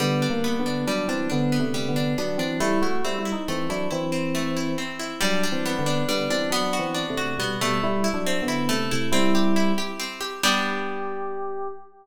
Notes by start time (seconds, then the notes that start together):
0.00 D3 G3 B3
0.22 D4
0.30 A#3
0.44 B3
0.59 D3 B3
0.66 D4
0.87 F#3 G3 D4
1.08 E3 C4 D4
1.30 D3 B3 D4
1.52 B3
1.60 C3 A3
1.74 G3
1.88 D3 B3
1.96 D4
2.18 F#3 B3 D4
2.38 E3 C4 D4
2.60 G3 A3 E4
2.82 A3 E4 F#4
3.04 G3 C4 E4
3.18 G3 E4
3.25 E4
3.32 D#4
3.48 E3 A3 C4
3.69 F#3 D4 E4
3.91 E3 C4 E4
4.12 C4
4.35 A3
4.57 E4
4.78 C4
4.99 E4
5.21 F#3 G3 D4
5.43 D4
5.52 E3 C4
5.66 B3
5.79 D3 B3
5.86 D4
6.09 D3 G3 B3
6.30 E3 C4 D4
6.50 F#3 B3 D4
6.73 F#4
6.79 E3 C4
6.94 D4
7.10 C3 A3
7.17 F#4
7.38 B2 G3 B3
7.61 B2 G3 A3
7.83 G3 E4
8.04 E4
8.14 F#3 D4
8.26 C4
8.42 D3 B3
8.48 E4
8.69 C3 A3
8.91 C3 A3 E4
9.12 G3 C4 E4
9.35 G4
9.56 E4
9.78 G4
10.00 C4
10.21 G4
10.43 G3 B3 D4 G4